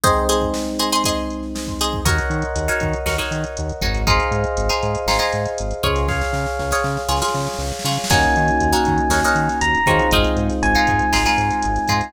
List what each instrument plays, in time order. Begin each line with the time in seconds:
0.04 electric piano 1 G#3 C4 D#4, acoustic guitar (steel) G#4 C5 D#5, kick, closed hi-hat
0.29 acoustic guitar (steel) G#4 C5 D#5, closed hi-hat
0.42 kick
0.54 snare
0.67 snare
0.79 acoustic guitar (steel) G#4 C5 D#5, closed hi-hat
0.92 acoustic guitar (steel) G#4 C5 D#5
1.04 acoustic guitar (steel) G#4 C5 D#5, kick, closed hi-hat
1.30 closed hi-hat
1.43 snare
1.56 snare
1.67 kick
1.79 acoustic guitar (steel) G#4 C5 D#5, closed hi-hat
1.93 kick
2.05 synth bass 1 D#2, acoustic guitar (steel) D#4 F#4 A#4 C#5, electric piano 1 A#4 C#5 D#5 F#5, kick, closed hi-hat
2.18 closed hi-hat
2.30 synth bass 1 D#3, closed hi-hat
2.42 closed hi-hat
2.55 synth bass 1 D#2, closed hi-hat
2.68 acoustic guitar (steel) D#4 F#4 A#4 C#5, closed hi-hat
2.80 synth bass 1 D#3, kick, closed hi-hat
2.93 closed hi-hat
3.06 synth bass 1 D#2, acoustic guitar (steel) D#4 F#4 A#4 C#5, snare
3.18 acoustic guitar (steel) D#4 F#4 A#4 C#5, closed hi-hat
3.31 synth bass 1 D#3, closed hi-hat
3.44 closed hi-hat
3.57 synth bass 1 D#2, closed hi-hat
3.69 closed hi-hat
3.81 synth bass 1 G#1, acoustic guitar (steel) D#4 F#4 A#4 C#5, kick, closed hi-hat
3.95 closed hi-hat
4.07 acoustic guitar (steel) D#4 F4 G#4 C5, electric piano 1 G#4 C5 D#5 F5, kick, closed hi-hat
4.20 closed hi-hat
4.31 synth bass 1 G#2, closed hi-hat
4.44 closed hi-hat
4.57 synth bass 1 G#1, closed hi-hat
4.69 acoustic guitar (steel) D#4 F4 G#4 C5, closed hi-hat
4.83 synth bass 1 G#2, closed hi-hat
4.95 closed hi-hat
5.06 synth bass 1 G#1, acoustic guitar (steel) D#4 F4 G#4 C5, snare
5.19 acoustic guitar (steel) D#4 F4 G#4 C5, closed hi-hat
5.32 synth bass 1 G#2, closed hi-hat
5.46 closed hi-hat
5.58 synth bass 1 G#1, closed hi-hat
5.71 closed hi-hat
5.83 synth bass 1 C#2, acoustic guitar (steel) F4 G#4 C#5, kick, closed hi-hat
5.96 snare, closed hi-hat
6.08 electric piano 1 G#4 C#5 F5, kick, snare
6.21 snare
6.33 synth bass 1 C#3, snare
6.46 snare
6.59 synth bass 1 C#2, snare
6.71 acoustic guitar (steel) F4 G#4 C#5, snare
6.84 synth bass 1 C#3, snare
6.97 snare
7.09 synth bass 1 C#2, acoustic guitar (steel) F4 G#4 C#5, snare
7.16 snare
7.22 acoustic guitar (steel) F4 G#4 C#5, snare
7.28 snare
7.34 synth bass 1 C#3, snare
7.40 snare
7.46 snare
7.54 snare
7.59 synth bass 1 C#2, snare
7.66 snare
7.72 snare
7.79 snare
7.84 synth bass 1 C#3, acoustic guitar (steel) F4 G#4 C#5, snare
7.91 snare
7.97 snare
8.04 snare
8.10 synth bass 1 D#2, electric piano 1 A#3 C#4 D#4 F#4 G#5, acoustic guitar (steel) D#4 F#4 A#4 C#5, kick, crash
8.23 closed hi-hat
8.36 synth bass 1 D#3, closed hi-hat
8.48 closed hi-hat
8.60 synth bass 1 D#2, closed hi-hat
8.72 acoustic guitar (steel) D#4 F#4 A#4 C#5, closed hi-hat
8.85 synth bass 1 D#3, kick, closed hi-hat
8.98 closed hi-hat
9.09 synth bass 1 D#2, acoustic guitar (steel) D#4 F#4 A#4 C#5, snare
9.24 acoustic guitar (steel) D#4 F#4 A#4 C#5, closed hi-hat
9.35 synth bass 1 D#3, closed hi-hat
9.49 snare, closed hi-hat
9.61 synth bass 1 D#2, electric piano 1 A#5, closed hi-hat
9.75 closed hi-hat
9.86 synth bass 1 D#3, electric piano 1 G#3 C4 D#4 F4, acoustic guitar (steel) D#4 F#4 A#4 C#5, kick, closed hi-hat
9.99 closed hi-hat
10.11 synth bass 1 G#1, acoustic guitar (steel) D#4 F4 G#4 C5, kick, closed hi-hat
10.24 closed hi-hat
10.36 synth bass 1 G#2, closed hi-hat
10.49 snare, closed hi-hat
10.63 synth bass 1 G#1, electric piano 1 G#5, closed hi-hat
10.75 acoustic guitar (steel) D#4 F4 G#4 C5, closed hi-hat
10.87 synth bass 1 G#2, kick, closed hi-hat
10.99 closed hi-hat
11.13 synth bass 1 G#1, acoustic guitar (steel) D#4 F4 G#4 C5, snare
11.26 acoustic guitar (steel) D#4 F4 G#4 C5, closed hi-hat
11.38 synth bass 1 G#2, closed hi-hat
11.51 closed hi-hat
11.62 synth bass 1 G#1, closed hi-hat
11.76 snare, closed hi-hat
11.88 synth bass 1 G#2, acoustic guitar (steel) D#4 F4 G#4 C5, kick, closed hi-hat
12.01 closed hi-hat